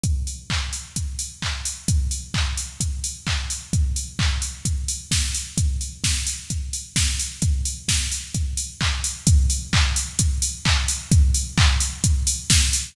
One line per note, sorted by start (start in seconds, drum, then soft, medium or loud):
0.04 kick loud
0.04 closed hi-hat medium
0.27 open hi-hat medium
0.50 kick medium
0.50 clap loud
0.73 open hi-hat medium
0.96 kick medium
0.96 closed hi-hat loud
1.19 open hi-hat medium
1.42 kick medium
1.42 clap loud
1.65 open hi-hat medium
1.88 kick loud
1.88 closed hi-hat loud
2.11 open hi-hat medium
2.34 kick medium
2.34 clap loud
2.57 open hi-hat medium
2.80 kick medium
2.80 closed hi-hat loud
3.04 open hi-hat medium
3.27 kick medium
3.27 clap loud
3.50 open hi-hat medium
3.73 kick loud
3.73 closed hi-hat medium
3.96 open hi-hat medium
4.19 kick loud
4.19 clap loud
4.42 open hi-hat medium
4.65 kick medium
4.65 closed hi-hat loud
4.88 open hi-hat medium
5.11 kick medium
5.11 snare loud
5.35 open hi-hat medium
5.58 kick loud
5.58 closed hi-hat loud
5.81 open hi-hat medium
6.04 kick medium
6.04 snare loud
6.27 open hi-hat medium
6.50 kick medium
6.50 closed hi-hat medium
6.73 open hi-hat medium
6.96 kick medium
6.96 snare loud
7.20 open hi-hat medium
7.42 kick loud
7.42 closed hi-hat loud
7.65 open hi-hat medium
7.88 kick medium
7.88 snare loud
8.12 open hi-hat medium
8.34 kick medium
8.34 closed hi-hat medium
8.57 open hi-hat medium
8.81 kick medium
8.81 clap loud
9.04 open hi-hat medium
9.27 kick loud
9.27 closed hi-hat loud
9.50 open hi-hat medium
9.73 kick loud
9.73 clap loud
9.96 open hi-hat medium
10.19 kick loud
10.19 closed hi-hat loud
10.42 open hi-hat loud
10.65 kick loud
10.65 clap loud
10.88 open hi-hat medium
11.12 kick loud
11.12 closed hi-hat loud
11.34 open hi-hat medium
11.58 kick loud
11.58 clap loud
11.80 open hi-hat medium
12.04 kick loud
12.04 closed hi-hat loud
12.27 open hi-hat loud
12.50 kick loud
12.50 snare loud
12.73 open hi-hat loud